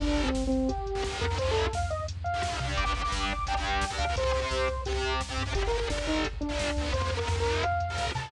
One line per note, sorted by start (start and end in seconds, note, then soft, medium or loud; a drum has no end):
0.00 0.29 G1 medium
0.00 0.28 D3 medium
0.00 0.28 G3 medium
0.00 0.22 D4 medium
0.00 kick loud
0.00 crash loud
0.09 kick medium
0.17 kick medium
0.17 closed hi-hat medium
0.23 0.44 C4 medium
0.23 kick medium
0.35 1.08 G1 medium
0.35 kick medium
0.35 snare loud
0.43 kick medium
0.47 0.70 C4 medium
0.52 kick medium
0.52 closed hi-hat medium
0.61 kick medium
0.69 1.18 G4 medium
0.69 kick loud
0.69 closed hi-hat loud
0.78 kick medium
0.86 kick medium
0.86 closed hi-hat medium
0.95 1.02 D3 medium
0.95 1.02 G3 medium
0.95 kick medium
1.04 1.25 D3 medium
1.04 1.25 G3 medium
1.04 kick medium
1.04 snare loud
1.12 kick medium
1.21 1.68 F2 medium
1.21 1.36 A#4 medium
1.21 kick medium
1.21 closed hi-hat medium
1.30 1.37 D3 medium
1.30 1.37 G3 medium
1.30 kick medium
1.38 1.66 C3 medium
1.38 1.66 F3 medium
1.38 1.50 C5 medium
1.38 kick loud
1.38 closed hi-hat loud
1.47 kick medium
1.51 1.61 A4 medium
1.56 kick medium
1.56 closed hi-hat medium
1.62 1.73 A4 medium
1.62 kick medium
1.73 2.47 F2 medium
1.73 1.89 F5 medium
1.73 kick loud
1.73 snare loud
1.82 kick medium
1.90 2.04 D#5 medium
1.90 kick medium
1.90 closed hi-hat medium
2.00 kick medium
2.08 kick medium
2.08 closed hi-hat loud
2.17 kick medium
2.24 2.66 F5 medium
2.24 kick medium
2.24 closed hi-hat medium
2.34 2.41 C3 medium
2.34 2.41 F3 medium
2.34 kick medium
2.43 2.60 C3 medium
2.43 2.60 F3 medium
2.43 kick medium
2.43 snare loud
2.52 kick loud
2.60 2.75 C3 medium
2.60 2.84 D4 medium
2.60 2.84 G4 medium
2.60 kick medium
2.60 closed hi-hat medium
2.69 kick medium
2.77 3.07 G1 medium
2.77 2.98 D6 medium
2.77 kick loud
2.77 closed hi-hat loud
2.85 2.92 D4 medium
2.85 2.92 G4 medium
2.85 kick medium
2.94 3.01 D4 medium
2.94 3.01 G4 medium
2.94 kick medium
2.94 closed hi-hat medium
3.01 3.33 D4 medium
3.01 3.33 G4 medium
3.01 3.20 D6 medium
3.01 kick medium
3.12 3.86 G1 medium
3.12 kick loud
3.12 snare loud
3.21 3.44 D6 medium
3.21 kick medium
3.29 kick medium
3.29 closed hi-hat medium
3.39 kick medium
3.47 3.54 D4 medium
3.47 3.54 G4 medium
3.47 3.91 G5 medium
3.47 kick medium
3.47 closed hi-hat loud
3.55 3.85 D4 medium
3.55 3.85 G4 medium
3.55 kick medium
3.64 kick medium
3.64 closed hi-hat medium
3.73 kick medium
3.81 kick loud
3.81 snare loud
3.90 4.04 D4 medium
3.90 4.04 G4 medium
3.90 kick medium
3.98 4.14 D2 medium
3.98 4.14 F5 medium
3.98 kick medium
3.98 closed hi-hat medium
4.07 4.16 D4 medium
4.07 4.15 G4 medium
4.07 kick medium
4.16 4.46 C2 medium
4.16 4.23 C4 medium
4.16 4.23 G4 medium
4.16 4.82 C5 medium
4.16 kick loud
4.16 closed hi-hat loud
4.24 4.31 C4 medium
4.24 4.31 G4 medium
4.24 kick loud
4.33 4.40 C4 medium
4.33 4.40 G4 medium
4.33 kick medium
4.33 closed hi-hat medium
4.41 4.68 C4 medium
4.41 4.68 G4 medium
4.41 kick medium
4.51 5.25 C2 medium
4.51 kick medium
4.51 snare loud
4.59 kick medium
4.68 kick medium
4.68 closed hi-hat medium
4.77 kick medium
4.85 4.93 C4 medium
4.85 5.14 G4 medium
4.85 4.93 G4 medium
4.85 kick loud
4.85 closed hi-hat loud
4.93 5.21 C4 medium
4.93 5.21 G4 medium
4.93 kick medium
5.03 kick medium
5.03 closed hi-hat medium
5.11 kick medium
5.20 kick loud
5.20 snare loud
5.29 5.43 C4 medium
5.29 5.43 G4 medium
5.29 kick medium
5.37 5.52 G2 medium
5.37 kick medium
5.37 closed hi-hat medium
5.46 5.53 C4 medium
5.46 5.53 G4 medium
5.46 kick medium
5.54 5.84 G1 medium
5.54 5.61 D3 medium
5.54 5.61 G3 medium
5.54 5.66 G4 medium
5.54 kick loud
5.54 closed hi-hat loud
5.63 5.71 D3 medium
5.63 5.71 G3 medium
5.63 kick medium
5.67 5.77 A#4 medium
5.72 5.79 D3 medium
5.72 5.79 G3 medium
5.72 kick medium
5.72 closed hi-hat medium
5.78 5.87 D3 medium
5.78 5.87 G3 medium
5.78 5.89 A#4 medium
5.78 kick medium
5.90 6.63 G1 medium
5.90 5.97 D3 medium
5.90 5.97 G3 medium
5.90 6.06 D4 medium
5.90 kick loud
5.90 snare loud
5.98 6.27 D3 medium
5.98 6.27 G3 medium
5.98 kick medium
6.07 6.24 D#4 medium
6.07 kick medium
6.07 closed hi-hat medium
6.16 kick medium
6.24 kick medium
6.24 closed hi-hat loud
6.33 kick medium
6.41 6.89 D4 medium
6.41 kick medium
6.41 closed hi-hat medium
6.49 6.70 D3 medium
6.49 6.70 G3 medium
6.49 kick medium
6.59 kick loud
6.59 snare loud
6.68 kick medium
6.76 6.91 D2 medium
6.76 6.92 D3 medium
6.76 6.92 G3 medium
6.76 kick medium
6.76 closed hi-hat medium
6.85 kick medium
6.93 7.23 F2 medium
6.93 7.00 C3 medium
6.93 7.00 F3 medium
6.93 7.12 C5 medium
6.93 kick loud
6.93 closed hi-hat loud
7.02 7.09 C3 medium
7.02 7.09 F3 medium
7.02 kick medium
7.11 7.18 C3 medium
7.11 7.18 F3 medium
7.11 kick medium
7.11 closed hi-hat medium
7.17 7.27 C3 medium
7.17 7.27 F3 medium
7.17 7.36 A#4 medium
7.17 kick medium
7.28 8.02 F2 medium
7.28 7.36 C3 medium
7.28 7.36 F3 medium
7.28 kick loud
7.28 snare loud
7.36 7.64 C3 medium
7.36 7.64 F3 medium
7.36 7.62 A#4 medium
7.36 kick medium
7.45 kick medium
7.45 closed hi-hat medium
7.54 kick medium
7.63 8.05 F5 medium
7.63 kick medium
7.63 closed hi-hat loud
7.72 kick medium
7.80 kick medium
7.80 closed hi-hat medium
7.89 8.11 C3 medium
7.89 8.11 F3 medium
7.89 kick medium
7.98 kick loud
7.98 snare loud
8.07 kick loud
8.15 8.28 C3 medium
8.15 8.30 C3 medium
8.15 8.28 F3 medium
8.15 8.30 A5 medium
8.15 kick medium
8.15 closed hi-hat medium
8.23 kick loud